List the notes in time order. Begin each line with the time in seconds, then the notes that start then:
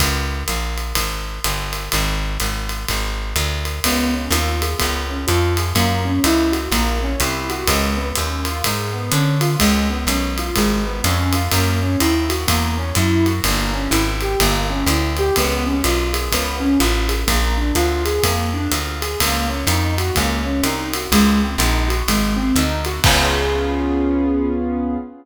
0.00 C#2, kick, ride
0.48 A#1, hi-hat pedal, ride
0.78 ride
0.95 G#1, kick, ride
1.44 G1, hi-hat pedal, ride
1.73 ride
1.92 G#1, kick, ride
2.40 G#1, hi-hat pedal, ride
2.69 ride
2.89 G#1, kick, ride
3.36 D2, hi-hat pedal, ride
3.65 ride
3.84 C#2 B3, kick, ride
4.14 C#4
4.30 D#2 F4, hi-hat pedal, ride
4.62 G#4, ride
4.79 C#2 B3, kick, ride
5.10 C#4
5.27 F2 F4, hi-hat pedal, ride
5.57 G#4, ride
5.75 F#2 A#3, kick, ride
6.05 C#4
6.24 C#2 E4, hi-hat pedal, ride
6.52 F#4, ride
6.71 A#1 A#3, kick, ride
7.03 C#4
7.20 C2 E4, hi-hat pedal, ride
7.50 F#4, ride
7.67 C#2 G#3, kick, ride
7.97 B3
8.15 D#2 C#4, hi-hat pedal, ride
8.45 F4, ride
8.64 G#2 G#3, kick, ride
8.93 B3
9.12 D3 C#4, hi-hat pedal, ride
9.41 F4, ride
9.59 C#2 G#3, kick, ride
9.90 B3
10.07 B1 C#4, hi-hat pedal, ride
10.38 F4, ride
10.56 G#1 G#3, kick, ride
10.86 B3
11.04 F2 C#4, hi-hat pedal, ride
11.33 F4, ride
11.52 F#2 A#3, kick, ride
11.81 C#4
12.00 D#2 E4, hi-hat pedal, ride
12.29 F#4, ride
12.48 E2 A#3, kick, ride
12.77 C#4
12.95 F#2 E4, hi-hat pedal, ride
13.26 F#4, ride
13.44 G1 A#3, kick, ride
13.74 C#4
13.91 G#1 E4, hi-hat pedal, ride
14.21 G4, ride
14.40 G1 A#3, kick, ride
14.70 C#4
14.86 D2 E4, hi-hat pedal, ride
15.17 G4, ride
15.36 C#2 B3, kick, ride
15.66 C#4
15.84 B1 F4, hi-hat pedal, ride
16.13 G#4, ride
16.32 C#2 B3, kick, ride
16.60 C#4
16.80 A1 F4, hi-hat pedal, ride
17.09 G#4, ride
17.27 A#1 A#3, kick, ride
17.58 D4
17.75 D2 F4, hi-hat pedal, ride
18.05 G#4, ride
18.23 F2 A#3, kick, ride
18.54 D4
18.71 D2 F4, hi-hat pedal, ride
19.02 G#4, ride
19.20 C#2 A#3, kick, ride
19.49 C#4
19.67 F2 D#4, hi-hat pedal, ride
19.98 F#4, ride
20.15 C#2 A#3, kick, ride
20.45 C#4
20.63 C2 D#4, hi-hat pedal, ride
20.93 F#4, ride
21.12 C#2 G#3, kick, ride
21.42 C4
21.58 A#1 D#4, hi-hat pedal, ride
21.88 F#4, ride
22.08 G#1 G#3, kick, ride
22.37 C4
22.55 D2 D#4, hi-hat pedal, ride
22.85 F#4, ride
23.04 C#2 B3 C#4 F4 G#4, kick, crash